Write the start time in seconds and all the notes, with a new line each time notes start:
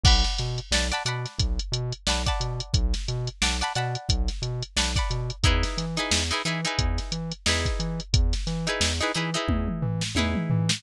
0.04 B1 D5 F#5 A5 B5, kick, crash
0.24 snare, closed hi-hat
0.38 B2, snare, closed hi-hat
0.58 closed hi-hat
0.71 B1 D5 F#5 A5 B5, snare
0.92 D5 F#5 A5 B5, closed hi-hat
1.05 B2 D5 F#5 A5 B5, closed hi-hat
1.26 snare, closed hi-hat
1.38 B1, kick, closed hi-hat
1.59 closed hi-hat
1.72 B2, closed hi-hat
1.92 closed hi-hat
2.07 B1 D5 F#5 A5 B5, snare
2.26 D5 F#5 A5 B5, kick, closed hi-hat
2.40 B2, closed hi-hat
2.60 closed hi-hat
2.73 B1, kick, closed hi-hat
2.94 snare, closed hi-hat
3.08 B2, closed hi-hat
3.27 closed hi-hat
3.42 B1 D5 F#5 A5 B5, snare
3.61 D5 F#5 A5 B5, closed hi-hat
3.75 B2 D5 F#5 A5 B5, snare, closed hi-hat
3.95 closed hi-hat
4.09 B1, kick, closed hi-hat
4.28 snare, closed hi-hat
4.42 B2, closed hi-hat
4.62 closed hi-hat
4.76 B1 D5 F#5 A5 B5, snare
4.96 D5 F#5 A5 B5, kick, closed hi-hat
5.10 B2, closed hi-hat
5.30 closed hi-hat
5.43 E2 D#4 E4 G#4 B4, kick, closed hi-hat
5.63 snare, closed hi-hat
5.77 E3, snare, closed hi-hat
5.96 D#4 E4 G#4 B4, snare, closed hi-hat
6.11 E2, snare
6.31 D#4 E4 G#4 B4, closed hi-hat
6.45 E3 D#4 E4 G#4 B4, closed hi-hat
6.65 D#4 E4 G#4 B4, closed hi-hat
6.78 E2, kick, closed hi-hat
6.98 snare, closed hi-hat
7.12 E3, closed hi-hat
7.31 closed hi-hat
7.46 E2 D#4 E4 G#4 B4, snare
7.65 kick, closed hi-hat
7.79 E3, closed hi-hat
8.00 closed hi-hat
8.13 E2, kick, closed hi-hat
8.33 snare, closed hi-hat
8.47 E3, snare, closed hi-hat
8.67 D#4 E4 G#4 B4, closed hi-hat
8.80 E2, snare
9.01 D#4 E4 G#4 B4, closed hi-hat
9.14 E3 D#4 E4 G#4 B4, closed hi-hat
9.34 D#4 E4 G#4 B4, closed hi-hat
9.48 E2, kick, high tom
9.68 mid tom
9.82 E3, floor tom
10.01 snare
10.15 E2 D#4 E4 G#4 B4, high tom
10.35 mid tom
10.50 E3, floor tom
10.69 snare